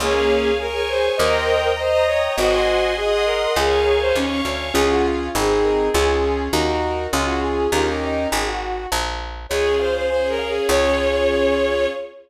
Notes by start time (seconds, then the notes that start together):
0.00 C#2 A#3 C#4 G#4 C#5 F5 G#5
0.30 F5
0.59 G#4 A#4 C#5 G#5 C#6
0.75 A#4
0.88 C5 F5
1.17 D#2 A#4 C5 D#5 G5 A#5
1.49 G5
1.76 C5 D#5 A#5 D#6
1.91 C5
2.07 C#5 G5
2.37 G#1 F#4 C5 D#5 F#5 G#5 C6
2.69 F#5
2.97 G#4 D#5 F#5 G#5 C6 D#6
3.11 G#4
3.25 A#4 C6
3.56 C#2 G#4 A#4 C#5 F5 G#5 C#6
3.85 G#5
4.01 C5
4.15 D#2 C#4 C#5 F5 C#6
4.45 D2 G#5
4.74 C#2 C#4 F4 G#4
4.90 F#4
5.05 F4
5.35 G#1 C4 D#4 G#4
5.63 A#4
5.93 C#2 C#4 F4 G#4
6.53 D#2 D#4 F#4 A#4
7.12 C#2 C#4 F4 G#4
7.26 F#4
7.43 G#4
7.72 D#2 C#4 D#4 F4 G4 A#4
8.04 D#4
8.32 G#1 G#4
8.46 F#4
8.92 A#1
9.49 C#2 C#4 F4 G#4 C#5
9.79 C5 F5
9.96 C5
10.09 C#4 G#4 C5 C#5 G#5
10.29 A#4
10.39 F5
10.48 G#4
10.68 C#2 C#4 F4 G#4 C#5